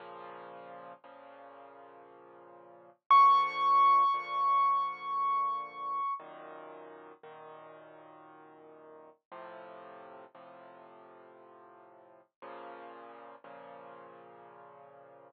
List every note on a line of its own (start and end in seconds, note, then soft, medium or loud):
0.00 0.93 A#2 medium
0.00 0.93 C#3 medium
0.00 0.93 F3 loud
1.04 2.90 A#2 medium
1.04 2.90 C#3 medium
1.04 2.90 F3 medium
3.10 4.03 A#2 medium
3.10 4.03 D3 loud
3.10 4.03 F3 loud
3.10 6.14 C#6 medium
4.14 6.00 A#2 medium
4.14 6.00 D3 medium
4.14 6.00 F3 medium
6.20 7.13 F#2 medium
6.20 7.13 A#2 medium
6.20 7.13 D#3 medium
7.23 9.09 F#2 medium
7.23 9.09 A#2 medium
7.23 9.09 D#3 medium
9.32 10.25 A2 medium
9.32 10.25 C3 medium
9.32 10.25 F3 medium
10.34 12.21 A2 medium
10.34 12.21 C3 medium
10.34 12.21 F3 medium
12.42 13.35 A#2 loud
12.42 13.35 C#3 medium
12.42 13.35 F3 medium
13.44 15.30 A#2 medium
13.44 15.30 C#3 medium
13.44 15.30 F3 medium